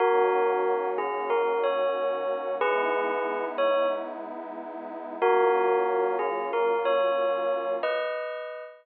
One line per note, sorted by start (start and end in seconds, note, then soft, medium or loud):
0.00 2.56 D#3 medium
0.00 2.56 A#3 medium
0.00 2.56 C#4 medium
0.00 0.88 F#4 medium
0.00 2.56 F#4 medium
0.00 0.88 A#4 loud
0.98 1.29 G#4 medium
1.30 1.60 A#4 medium
1.64 2.54 C#5 medium
2.61 5.16 G#3 medium
2.61 5.16 B3 medium
2.61 5.16 D#4 medium
2.61 5.16 E4 medium
2.61 3.44 G#4 loud
2.61 3.44 B4 loud
3.58 3.87 C#5 medium
5.22 7.77 F#3 medium
5.22 7.77 A#3 loud
5.22 7.77 C#4 medium
5.22 7.77 F4 medium
5.22 6.16 F#4 medium
5.22 6.16 A#4 loud
6.19 6.46 G#4 medium
6.53 6.81 A#4 medium
6.85 7.71 C#5 medium
7.83 8.63 B4 medium
7.83 8.63 D#5 medium